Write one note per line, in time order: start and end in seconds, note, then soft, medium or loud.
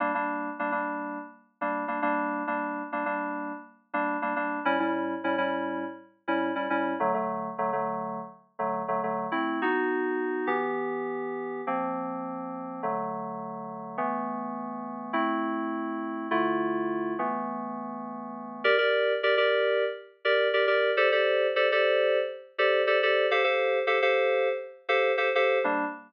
0.00 0.12 G3 medium
0.00 0.12 A#3 loud
0.00 0.12 D4 medium
0.15 0.50 G3 medium
0.15 0.50 A#3 medium
0.15 0.50 D4 medium
0.59 0.71 G3 medium
0.59 0.71 A#3 medium
0.59 0.71 D4 medium
0.72 1.18 G3 medium
0.72 1.18 A#3 medium
0.72 1.18 D4 medium
1.61 1.84 G3 medium
1.61 1.84 A#3 medium
1.61 1.84 D4 medium
1.88 2.00 G3 medium
1.88 2.00 A#3 medium
1.88 2.00 D4 medium
2.02 2.43 G3 medium
2.02 2.43 A#3 loud
2.02 2.43 D4 medium
2.47 2.82 G3 medium
2.47 2.82 A#3 medium
2.47 2.82 D4 medium
2.92 3.04 G3 medium
2.92 3.04 A#3 medium
2.92 3.04 D4 medium
3.06 3.52 G3 medium
3.06 3.52 A#3 medium
3.06 3.52 D4 medium
3.94 4.17 G3 medium
3.94 4.17 A#3 medium
3.94 4.17 D4 medium
4.22 4.34 G3 medium
4.22 4.34 A#3 medium
4.22 4.34 D4 medium
4.36 4.59 G3 medium
4.36 4.59 A#3 medium
4.36 4.59 D4 medium
4.65 4.77 A2 loud
4.65 4.77 G3 medium
4.65 4.77 C#4 loud
4.65 4.77 E4 loud
4.80 5.15 A2 medium
4.80 5.15 G3 medium
4.80 5.15 C#4 medium
4.80 5.15 E4 medium
5.24 5.36 A2 loud
5.24 5.36 G3 medium
5.24 5.36 C#4 medium
5.24 5.36 E4 medium
5.38 5.84 A2 medium
5.38 5.84 G3 medium
5.38 5.84 C#4 medium
5.38 5.84 E4 medium
6.28 6.51 A2 medium
6.28 6.51 G3 medium
6.28 6.51 C#4 medium
6.28 6.51 E4 medium
6.55 6.67 A2 medium
6.55 6.67 G3 medium
6.55 6.67 C#4 medium
6.55 6.67 E4 medium
6.70 6.93 A2 medium
6.70 6.93 G3 medium
6.70 6.93 C#4 loud
6.70 6.93 E4 medium
7.00 7.12 D3 medium
7.00 7.12 F#3 loud
7.00 7.12 A3 medium
7.14 7.49 D3 medium
7.14 7.49 F#3 medium
7.14 7.49 A3 medium
7.58 7.70 D3 medium
7.58 7.70 F#3 medium
7.58 7.70 A3 medium
7.73 8.19 D3 medium
7.73 8.19 F#3 medium
7.73 8.19 A3 medium
8.59 8.82 D3 medium
8.59 8.82 F#3 medium
8.59 8.82 A3 medium
8.88 9.00 D3 medium
8.88 9.00 F#3 medium
8.88 9.00 A3 medium
9.03 9.26 D3 medium
9.03 9.26 F#3 medium
9.03 9.26 A3 medium
9.32 9.59 A3 medium
9.32 9.59 C4 medium
9.32 9.59 E4 medium
9.62 10.47 B3 medium
9.62 10.48 D#4 medium
9.62 10.48 F#4 medium
10.47 11.61 E3 medium
10.47 11.61 B3 medium
10.47 11.61 G4 medium
11.67 12.81 F3 medium
11.67 12.81 A#3 medium
11.67 12.81 C4 medium
12.83 13.97 D3 medium
12.83 13.97 F#3 medium
12.83 13.97 A3 medium
13.98 15.12 E3 medium
13.98 15.12 A3 medium
13.98 15.12 B3 medium
15.13 16.27 A3 medium
15.13 16.27 C4 medium
15.13 16.27 E4 medium
16.31 17.14 D3 medium
16.31 17.14 A3 medium
16.31 17.14 E4 medium
16.31 17.14 F4 medium
17.19 18.62 E3 medium
17.19 18.62 A3 medium
17.19 18.62 B3 medium
18.64 18.76 G4 loud
18.64 18.76 A#4 loud
18.64 18.76 D5 loud
18.78 19.13 G4 medium
18.78 19.13 A#4 medium
18.78 19.13 D5 medium
19.23 19.35 G4 medium
19.23 19.35 A#4 medium
19.23 19.35 D5 medium
19.37 19.84 G4 medium
19.37 19.84 A#4 medium
19.37 19.84 D5 medium
20.25 20.48 G4 medium
20.25 20.48 A#4 medium
20.25 20.48 D5 medium
20.53 20.65 G4 medium
20.53 20.65 A#4 medium
20.53 20.65 D5 medium
20.67 20.91 G4 medium
20.67 20.91 A#4 medium
20.67 20.91 D5 medium
20.97 21.09 G4 loud
20.97 21.09 A4 loud
20.97 21.09 C5 loud
20.97 21.09 D5 medium
21.12 21.47 G4 medium
21.12 21.47 A4 medium
21.12 21.47 C5 medium
21.12 21.47 D5 medium
21.56 21.67 G4 medium
21.56 21.67 A4 medium
21.56 21.67 C5 medium
21.56 21.67 D5 medium
21.72 22.18 G4 medium
21.72 22.18 A4 medium
21.72 22.18 C5 medium
21.72 22.18 D5 medium
22.58 22.82 G4 loud
22.58 22.82 A4 medium
22.58 22.82 C5 medium
22.58 22.82 D5 medium
22.87 22.99 G4 medium
22.87 22.99 A4 medium
22.87 22.99 C5 medium
22.87 22.99 D5 medium
23.03 23.26 G4 medium
23.03 23.26 A4 medium
23.03 23.26 C5 medium
23.03 23.26 D5 medium
23.31 23.43 G4 loud
23.31 23.43 A4 medium
23.31 23.43 C5 loud
23.31 23.43 F5 loud
23.44 23.79 G4 medium
23.44 23.79 A4 medium
23.44 23.79 C5 medium
23.44 23.79 F5 medium
23.87 23.99 G4 medium
23.87 23.99 A4 loud
23.87 23.99 C5 medium
23.87 23.99 F5 medium
24.02 24.49 G4 medium
24.02 24.49 A4 medium
24.02 24.49 C5 medium
24.02 24.49 F5 medium
24.89 25.12 G4 medium
24.89 25.12 A4 medium
24.89 25.12 C5 medium
24.89 25.12 F5 medium
25.17 25.29 G4 medium
25.17 25.29 A4 medium
25.17 25.29 C5 loud
25.17 25.29 F5 medium
25.35 25.58 G4 medium
25.35 25.58 A4 medium
25.35 25.58 C5 medium
25.35 25.58 F5 medium
25.64 25.85 G3 medium
25.64 25.85 A#3 medium
25.64 25.85 D4 loud